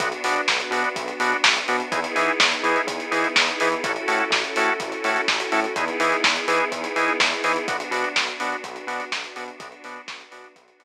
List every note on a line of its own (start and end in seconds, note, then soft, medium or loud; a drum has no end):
0.00 0.12 B1 loud
0.00 1.90 B3 loud
0.00 0.09 B3 loud
0.00 1.90 D4 medium
0.00 0.09 D4 loud
0.00 1.90 F#4 medium
0.00 0.09 F#4 loud
0.00 kick loud
0.00 closed hi-hat loud
0.12 closed hi-hat medium
0.24 0.37 B2 medium
0.24 0.41 B3 loud
0.24 0.41 D4 loud
0.24 0.41 F#4 medium
0.24 open hi-hat loud
0.36 closed hi-hat medium
0.47 0.61 B1 medium
0.47 kick medium
0.47 snare loud
0.60 closed hi-hat medium
0.71 0.84 B2 medium
0.71 0.89 B3 loud
0.71 0.89 D4 medium
0.71 0.89 F#4 medium
0.71 open hi-hat medium
0.84 closed hi-hat medium
0.96 1.10 B1 medium
0.96 kick loud
0.96 closed hi-hat loud
1.08 closed hi-hat medium
1.20 1.33 B2 loud
1.20 1.37 B3 loud
1.20 1.37 D4 loud
1.20 1.37 F#4 loud
1.20 open hi-hat loud
1.32 closed hi-hat medium
1.44 1.58 B1 medium
1.44 kick loud
1.44 snare loud
1.56 closed hi-hat medium
1.68 1.81 B2 medium
1.68 1.77 B3 loud
1.68 1.77 D4 loud
1.68 1.77 F#4 loud
1.68 open hi-hat medium
1.80 closed hi-hat medium
1.92 2.05 E2 loud
1.92 2.00 B3 loud
1.92 3.82 B3 loud
1.92 2.00 D#4 loud
1.92 3.82 D#4 loud
1.92 2.00 E4 loud
1.92 3.82 E4 medium
1.92 2.00 G#4 loud
1.92 3.82 G#4 medium
1.92 kick loud
1.92 closed hi-hat loud
2.04 closed hi-hat loud
2.15 2.30 E3 medium
2.15 2.32 B3 medium
2.15 2.32 D#4 medium
2.15 2.32 E4 loud
2.15 2.32 G#4 loud
2.15 open hi-hat medium
2.28 closed hi-hat medium
2.40 2.53 E2 medium
2.40 kick loud
2.40 snare loud
2.52 closed hi-hat medium
2.63 2.77 E3 medium
2.63 2.81 B3 loud
2.63 2.81 D#4 loud
2.63 2.81 E4 loud
2.63 2.81 G#4 loud
2.63 open hi-hat medium
2.76 closed hi-hat medium
2.87 3.00 E2 medium
2.87 kick loud
2.87 closed hi-hat loud
3.00 closed hi-hat medium
3.11 3.25 E3 medium
3.11 3.28 B3 medium
3.11 3.28 D#4 loud
3.11 3.28 E4 loud
3.11 3.28 G#4 loud
3.11 open hi-hat medium
3.24 closed hi-hat medium
3.36 3.50 E2 medium
3.36 kick loud
3.36 snare loud
3.48 closed hi-hat medium
3.60 3.75 E3 loud
3.60 3.69 B3 loud
3.60 3.69 D#4 loud
3.60 3.69 E4 loud
3.60 3.69 G#4 medium
3.60 open hi-hat loud
3.72 closed hi-hat medium
3.84 3.97 A1 loud
3.84 3.92 C#4 loud
3.84 5.74 C#4 medium
3.84 3.92 E4 loud
3.84 5.74 E4 medium
3.84 3.92 F#4 loud
3.84 5.74 F#4 medium
3.84 3.92 A4 loud
3.84 5.74 A4 medium
3.84 kick loud
3.84 closed hi-hat loud
3.96 closed hi-hat medium
4.08 4.21 A2 medium
4.08 4.24 C#4 loud
4.08 4.24 E4 loud
4.08 4.24 F#4 loud
4.08 4.24 A4 medium
4.08 open hi-hat loud
4.20 closed hi-hat medium
4.30 4.44 A1 loud
4.30 kick loud
4.30 snare loud
4.44 closed hi-hat medium
4.56 4.70 A2 medium
4.56 4.74 C#4 loud
4.56 4.74 E4 medium
4.56 4.74 F#4 loud
4.56 4.74 A4 loud
4.56 open hi-hat loud
4.68 closed hi-hat medium
4.80 4.93 A1 medium
4.80 kick loud
4.80 closed hi-hat loud
4.92 closed hi-hat medium
5.04 5.17 A2 medium
5.04 5.21 C#4 loud
5.04 5.21 E4 medium
5.04 5.21 F#4 medium
5.04 5.21 A4 loud
5.04 open hi-hat medium
5.16 closed hi-hat medium
5.28 5.41 A1 medium
5.28 kick loud
5.28 snare loud
5.40 closed hi-hat loud
5.52 5.66 A2 medium
5.52 5.60 C#4 medium
5.52 5.60 E4 loud
5.52 5.60 F#4 medium
5.52 5.60 A4 loud
5.52 open hi-hat medium
5.64 closed hi-hat medium
5.76 5.89 E2 loud
5.76 7.66 B3 loud
5.76 5.85 B3 loud
5.76 7.66 D#4 medium
5.76 5.85 D#4 loud
5.76 7.66 E4 loud
5.76 5.85 E4 loud
5.76 7.66 G#4 loud
5.76 5.85 G#4 loud
5.76 kick loud
5.76 closed hi-hat loud
5.88 closed hi-hat medium
6.00 6.13 E3 loud
6.00 6.17 B3 loud
6.00 6.17 D#4 medium
6.00 6.17 E4 loud
6.00 6.17 G#4 medium
6.00 open hi-hat loud
6.12 closed hi-hat medium
6.24 6.38 E2 medium
6.24 kick loud
6.24 snare loud
6.36 closed hi-hat medium
6.48 6.61 E3 loud
6.48 6.65 B3 loud
6.48 6.65 D#4 medium
6.48 6.65 E4 medium
6.48 6.65 G#4 loud
6.48 open hi-hat loud
6.60 closed hi-hat medium
6.72 6.85 E2 medium
6.72 kick medium
6.72 closed hi-hat loud
6.84 closed hi-hat loud
6.96 7.09 E3 medium
6.96 7.13 B3 loud
6.96 7.13 D#4 loud
6.96 7.13 E4 medium
6.96 7.13 G#4 loud
6.96 open hi-hat medium
7.08 closed hi-hat medium
7.20 7.33 E2 medium
7.20 kick loud
7.20 snare loud
7.32 closed hi-hat medium
7.44 7.57 E3 medium
7.44 7.52 B3 medium
7.44 7.52 D#4 loud
7.44 7.52 E4 medium
7.44 7.52 G#4 loud
7.44 open hi-hat medium
7.56 closed hi-hat medium
7.68 7.82 B1 medium
7.68 9.58 B3 medium
7.68 7.77 B3 loud
7.68 9.58 D4 loud
7.68 7.77 D4 loud
7.68 9.58 F#4 loud
7.68 7.77 F#4 loud
7.68 kick loud
7.68 closed hi-hat loud
7.80 closed hi-hat loud
7.91 8.04 B2 medium
7.91 8.09 B3 medium
7.91 8.09 D4 medium
7.91 8.09 F#4 loud
7.91 open hi-hat loud
8.04 closed hi-hat medium
8.16 8.29 B1 medium
8.16 kick loud
8.16 snare loud
8.28 closed hi-hat medium
8.40 8.54 B2 medium
8.40 8.56 B3 loud
8.40 8.56 D4 loud
8.40 8.56 F#4 loud
8.40 open hi-hat loud
8.52 closed hi-hat medium
8.64 8.77 B1 loud
8.64 kick medium
8.64 closed hi-hat loud
8.76 closed hi-hat medium
8.87 9.00 B2 medium
8.87 9.05 B3 loud
8.87 9.05 D4 loud
8.87 9.05 F#4 loud
8.87 open hi-hat medium
9.00 closed hi-hat loud
9.12 9.25 B1 medium
9.12 kick medium
9.12 snare loud
9.24 closed hi-hat medium
9.36 9.50 B2 medium
9.36 9.44 B3 medium
9.36 9.44 D4 loud
9.36 9.44 F#4 loud
9.36 open hi-hat loud
9.48 closed hi-hat medium
9.60 9.73 B1 loud
9.60 9.68 B3 loud
9.60 10.84 B3 medium
9.60 9.68 D4 loud
9.60 10.84 D4 loud
9.60 9.68 F#4 loud
9.60 10.84 F#4 loud
9.60 kick loud
9.60 closed hi-hat loud
9.72 closed hi-hat medium
9.84 9.98 B2 loud
9.84 10.01 B3 loud
9.84 10.01 D4 loud
9.84 10.01 F#4 loud
9.84 open hi-hat loud
9.96 closed hi-hat medium
10.08 10.22 B1 medium
10.08 kick loud
10.08 snare loud
10.20 closed hi-hat medium
10.31 10.46 B2 medium
10.31 10.48 B3 medium
10.31 10.48 D4 loud
10.31 10.48 F#4 medium
10.31 open hi-hat loud
10.44 closed hi-hat medium
10.56 10.69 B1 medium
10.56 kick loud
10.56 closed hi-hat loud
10.68 closed hi-hat medium
10.79 10.84 B2 medium
10.79 10.84 B3 loud
10.79 10.84 D4 loud
10.79 10.84 F#4 loud
10.79 open hi-hat loud